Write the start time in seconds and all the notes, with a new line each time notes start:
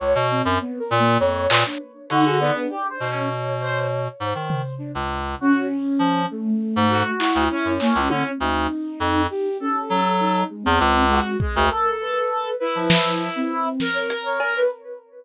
0.00 C#2 C#5
0.15 B2
0.31 C4
0.45 F#2
0.61 B3
0.79 A#4
0.91 A#2
0.99 A#3
1.20 F2 C#5
1.50 A#2 B4, clap
1.66 D4
2.10 D3 D#4 F#4, closed hi-hat
2.26 G#4
2.40 B3 D5
2.55 D4
2.69 G4
2.90 C5
3.00 B2
3.10 C#4 C#5
3.60 C5
4.20 G#2 C5
4.35 D#3
4.50 floor tom
4.78 D4
4.95 C#2
5.40 C#4 F#4
5.99 F3
6.31 A3
6.76 G#2
6.89 F#4
7.19 E4, clap
7.35 D2
7.50 C#4
7.65 F#2
7.80 A#3, clap
7.95 C#2
8.10 D3, high tom
8.40 D2 D#4
9.00 F2
9.30 G4
9.60 C#4 A4
9.90 F#3
10.20 D#4
10.50 G#3
10.63 E2 C4
10.80 C#2
11.09 G#3 F#4
11.39 G#3, kick
11.55 D2 A#4
11.70 A4
12.01 B4
12.60 E4 B4
12.75 F3
12.90 snare
13.36 C4
13.80 A#4, snare
13.94 C#5
14.10 closed hi-hat
14.26 C#5
14.40 A#4, cowbell
14.56 B4